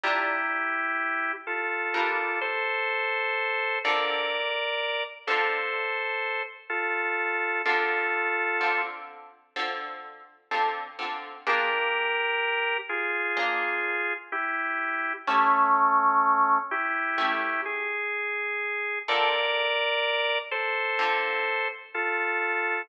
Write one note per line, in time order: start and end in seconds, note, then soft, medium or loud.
0.03 0.70 G3 loud
0.03 0.70 D4 loud
0.03 1.32 E4 medium
0.03 0.70 F4 loud
0.03 1.32 G4 medium
0.03 0.70 A#4 loud
1.47 2.39 F4 medium
1.47 2.39 A4 medium
1.94 2.61 G3 loud
1.94 2.61 D4 loud
1.94 2.61 F4 loud
1.94 2.61 A#4 loud
2.41 3.79 A4 medium
2.41 3.79 C5 medium
3.84 4.51 D3 loud
3.84 4.51 C4 loud
3.84 4.51 F4 loud
3.84 4.51 A4 loud
3.84 5.04 A#4 medium
3.84 5.04 D5 medium
5.27 6.42 D3 loud
5.27 6.42 C4 loud
5.27 6.42 F4 loud
5.27 6.42 A4 medium
5.27 6.42 A4 loud
5.27 6.42 C5 medium
6.69 7.62 F4 medium
6.69 7.62 A4 medium
7.65 8.32 D3 loud
7.65 8.32 C4 loud
7.65 8.32 F4 loud
7.65 8.82 F4 medium
7.65 8.32 A4 loud
7.65 8.82 A4 medium
8.61 9.27 D3 medium
8.61 9.27 C4 medium
8.61 9.27 F4 medium
8.61 9.27 A4 loud
9.56 10.23 D3 loud
9.56 10.23 C4 loud
9.56 10.23 F4 loud
9.56 10.23 A4 loud
10.51 10.85 D3 loud
10.51 10.85 C4 loud
10.51 10.85 F4 medium
10.51 10.85 A4 loud
10.99 11.32 D3 medium
10.99 11.32 C4 medium
10.99 11.32 F4 medium
10.99 11.32 A4 medium
11.47 12.13 A#3 loud
11.47 12.13 D4 loud
11.47 12.13 F4 loud
11.47 12.77 G4 medium
11.47 12.13 G#4 loud
11.47 12.77 A#4 loud
12.89 14.13 F4 medium
12.89 14.13 G#4 medium
13.37 14.03 A#3 loud
13.37 14.03 D4 loud
13.37 14.03 F4 loud
13.37 14.03 G#4 loud
14.32 15.13 E4 medium
14.32 15.13 G4 medium
15.27 15.94 A3 loud
15.27 16.58 A3 medium
15.27 15.94 C#4 loud
15.27 16.58 C#4 medium
15.27 15.94 E4 loud
15.27 15.94 G4 loud
16.71 17.61 E4 medium
16.71 17.61 G4 medium
17.18 17.85 A3 loud
17.18 17.85 C#4 loud
17.18 17.85 E4 loud
17.18 17.85 G4 loud
17.65 18.99 G#4 medium
19.08 19.75 D3 loud
19.08 19.75 C4 loud
19.08 19.75 F4 loud
19.08 19.75 A4 loud
19.08 20.38 A#4 medium
19.08 20.38 D5 medium
20.51 21.68 A4 medium
20.51 21.68 C5 medium
20.99 21.65 D3 loud
20.99 21.65 C4 loud
20.99 21.65 F4 loud
20.99 21.65 A4 loud
21.94 22.82 F4 medium
21.94 22.82 A4 medium